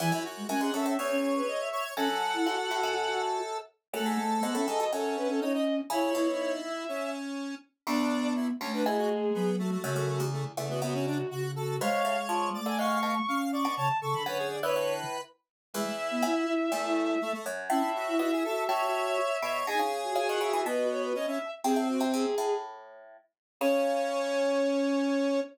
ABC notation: X:1
M:4/4
L:1/16
Q:1/4=122
K:C#m
V:1 name="Violin"
g z3 g f e e c2 c B d e2 z | f12 z4 | f z3 f e d d A2 B A c d2 z | c6 e4 z6 |
[K:F#m] d4 z3 B G6 F2 | F4 z3 F F6 F2 | ^e4 z3 g c'6 c'2 | a2 c' b c2 d c3 z6 |
[K:C#m] e16 | e16 | g z3 g f e e B2 c B d e2 z | G z F z G4 z8 |
c16 |]
V:2 name="Lead 1 (square)"
E2 F2 F G A2 c6 c2 | A14 z2 | A8 C4 D D z2 | E8 C6 z2 |
[K:F#m] D4 E z C D E F z2 B,2 A, A, | A, A,2 z A, z A, B, B, C D z F2 A2 | c6 d2 ^e2 e z e2 d2 | c z A2 B G2 B5 z4 |
[K:C#m] E8 A,4 A, A, z2 | E2 F2 F G A2 c6 c2 | G8 B,4 C C z2 | ^B,6 z10 |
C16 |]
V:3 name="Flute"
E, z2 G, C2 C2 z C3 z4 | C z2 E F2 F2 z F3 z4 | A,2 A,2 B, C z4 C C C4 | E2 E D3 z10 |
[K:F#m] B,6 A,6 F,4 | C,6 C,6 C,4 | G,6 A,6 C4 | C, z C, D,9 z4 |
[K:C#m] G, z2 B, E2 E2 z E3 z4 | C z2 E E2 F2 z F3 z4 | D z2 F F2 F2 z F3 z4 | ^B,6 z10 |
C16 |]
V:4 name="Pizzicato Strings" clef=bass
E,, F,,3 F,, G,, F,, A,, E,,8 | F,,4 G,, z A,, F,,7 z2 | F,, G,,3 G,, A,, G,, B,, F,,8 | C,2 B,,8 z6 |
[K:F#m] D,,6 D,,2 G,,6 z2 | F,, F,,2 E,,3 E,,2 F,,4 z4 | G,,2 A,, z ^E,3 D, G,,2 B,, z4 B,, | z4 F,,3 E,, A,,4 z4 |
[K:C#m] E,,4 F,, z3 E,,4 z2 F,,2 | A,,4 B,, z3 A,,4 z2 B,,2 | B,, C,3 C, D, C, E, B,,8 | ^B,, A,, z B,, B,,2 A,,8 z2 |
C,16 |]